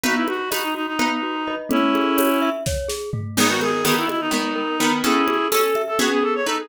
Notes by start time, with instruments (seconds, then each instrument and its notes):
0.03 glockenspiel B3, pizzicato strings D#4 B4, clarinet F#4, low conga
0.16 clarinet E4
0.27 glockenspiel F#4, clarinet F#4, high conga
0.51 pizzicato strings D#4 B4, clarinet F#4, glockenspiel D#5, tambourine, high conga
0.63 clarinet D#4
0.75 clarinet D#4, glockenspiel F#4
0.87 clarinet D#4
0.99 glockenspiel B3, pizzicato strings D#4 B4, low conga
1.23 glockenspiel F#4
1.47 pizzicato strings D#4 B4, glockenspiel D#5
1.69 glockenspiel A3, pizzicato strings C#4 A4, clarinet C#4 E4, low conga
1.95 glockenspiel G#4, high conga
2.17 glockenspiel C#5, tambourine, high conga
2.42 glockenspiel E5
2.66 glockenspiel C#5, kick, snare
2.88 glockenspiel G#4, snare
3.13 glockenspiel A3, floor tom
3.37 pizzicato strings D#3 B3, glockenspiel G#3, clarinet G#4, crash, low conga
3.49 clarinet F#4
3.61 clarinet G#4, glockenspiel A#4, high conga
3.85 pizzicato strings D#3 B3, clarinet G#4, glockenspiel B4, tambourine, high conga
3.97 clarinet E4
4.08 clarinet E4, glockenspiel D#5, high conga
4.20 clarinet D#4
4.31 pizzicato strings D#3 B3, glockenspiel G#3, low conga
4.56 glockenspiel A#4
4.80 pizzicato strings D#3 B3, glockenspiel B4
5.03 glockenspiel C#4, pizzicato strings C#4 A4, clarinet E4 G#4, low conga
5.28 glockenspiel G#4, high conga
5.51 pizzicato strings C#4 A4, clarinet A4, glockenspiel A4, tambourine, high conga
5.75 glockenspiel E5, high conga
5.88 clarinet A4
5.99 pizzicato strings B3 G#4, glockenspiel C#4, clarinet F#4, low conga
6.12 clarinet G#4
6.23 glockenspiel G#4, clarinet A4
6.35 clarinet C#5
6.46 pizzicato strings D#4 B4, clarinet A4, glockenspiel A4
6.59 clarinet G#4